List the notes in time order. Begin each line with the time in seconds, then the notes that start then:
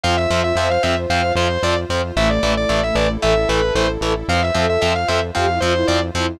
0.04 F2 F3 C4 F4 C5 F5
0.17 E5
0.30 F2 F3 C4
0.44 E5
0.55 F2 F3 C4 C5 E5
0.70 F5
0.83 F2 F3 C4 E5
1.09 F2 F3 C4 F5
1.35 F2 F3 C4 C5
1.63 F2 F3 C4 D5
1.89 F2 F3 C4
2.16 A1 E3 A3 E4 A4 E5
2.30 D5
2.43 A1 E3 A3
2.57 D5
2.69 A1 E3 A3 D5
2.83 E5
2.95 A1 E3 A3 D5
3.21 A1 E3 A3 A4 E5
3.49 A1 E3 A3 B4
3.75 A1 E3 A3 C5
4.01 A1 E3 A3
4.28 F2 F3 C4 F4 C5 F5
4.42 E5
4.55 F2 F3 C4 A4
4.69 E5
4.81 F2 F3 C4 E5
4.95 F5
5.08 F2 F3 C4 A4 E5
5.35 F2 F3 C4 G4 F5
5.48 E4
5.60 F2 F3 C4 F4 C5
5.74 E4
5.87 F2 F3 C4 D5
6.14 F2 F3 C4 E4